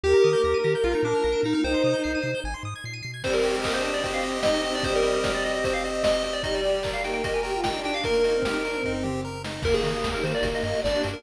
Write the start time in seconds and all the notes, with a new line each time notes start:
0.04 D#2 A#3 D#4 G4 A#4 G5
0.14 A#5
0.24 D#3 D#6
0.33 G6
0.44 D#2 A#3 G4 A#4 A#6
0.54 D#7
0.64 D#3 G4 A#6
0.75 G6
0.84 A#1 A#3 D4 F4 F5
0.93 D#4 A#5
1.03 A#2 D4 D6
1.14 F6
1.24 A#1 A#3 F4 A#4 A#6
1.32 D7
1.43 A#2 D#4 A#6
1.53 D#4 F6
1.63 C2 D#4 C5 G5
1.74 C6
1.84 C3 D#6
1.94 G6
2.04 C2 C7
2.15 D#7
2.22 C3 C7
2.35 G6
2.44 G#1 G#5
2.54 C6
2.63 G#2 D#6
2.76 G#6
2.84 A#2 C7
2.94 D#7
3.03 B2 C7
3.14 G#6
3.23 G3 C4 C5, kick, crash
3.33 A#4, closed hi-hat
3.43 G3 G4, open hi-hat
3.55 G#3, closed hi-hat
3.64 A#3 D#5, kick, clap
3.73 D4 C5, closed hi-hat
3.82 C4 C5, open hi-hat
3.94 D5, closed hi-hat
4.03 C4 G4 C5, kick, closed hi-hat
4.13 F5, closed hi-hat
4.23 D#5, open hi-hat
4.35 closed hi-hat
4.43 C4 D#4 D#5, kick, snare
4.54 closed hi-hat
4.63 C4 G4 D#5, open hi-hat
4.74 D4 D5, open hi-hat
4.83 G3 C5 D#5, kick, closed hi-hat
4.95 A#4, closed hi-hat
5.02 C4, open hi-hat
5.14 closed hi-hat
5.24 G4, kick, snare
5.34 D5, closed hi-hat
5.44 D#5, open hi-hat
5.54 D#5, closed hi-hat
5.64 C4 C5, kick, closed hi-hat
5.74 F5, closed hi-hat
5.84 G4 D#5, open hi-hat
5.93 closed hi-hat
6.03 D#5, kick, snare
6.14 closed hi-hat
6.24 C4 D#5, open hi-hat
6.33 D5, closed hi-hat
6.43 G3 D#4 D#5, kick, closed hi-hat
6.55 D5, closed hi-hat
6.64 G4, open hi-hat
6.74 closed hi-hat
6.83 A#4, kick, clap
6.93 F5, closed hi-hat
7.03 A#3 D#4 G5, open hi-hat
7.14 G5, closed hi-hat
7.23 G4 A#4 D#5, kick, closed hi-hat
7.34 G#5, closed hi-hat
7.43 G4 A#4 G5, open hi-hat
7.53 F4, closed hi-hat
7.64 D#4 G5, kick, snare
7.74 D4, closed hi-hat
7.84 G4 G5, open hi-hat
7.94 F5, closed hi-hat
8.04 A#3 A#4, kick, closed hi-hat
8.14 A#3, closed hi-hat
8.24 A#3 D#4, open hi-hat
8.34 C4, closed hi-hat
8.42 D#4 G4, kick, snare
8.53 closed hi-hat
8.64 D4 A#4, open hi-hat
8.74 C4, closed hi-hat
8.83 D#4, kick, floor tom
9.03 G4, mid tom
9.25 A#4
9.44 D#4, snare
9.62 D#2 A#3 D#4 G4 A#4, kick, crash
9.74 G#4, closed hi-hat
9.83 D#3, open hi-hat
9.95 closed hi-hat
10.04 D#2, kick, snare
10.14 A#4, closed hi-hat
10.23 D#3 A#3 C5, open hi-hat
10.34 D5, closed hi-hat
10.43 G1 A#3 D4 G4, kick, closed hi-hat
10.54 D#5, closed hi-hat
10.63 G2 D#5, open hi-hat
10.73 closed hi-hat
10.82 G1 D4 D5, kick, snare
10.95 closed hi-hat
11.03 G2, open hi-hat
11.13 A#4, closed hi-hat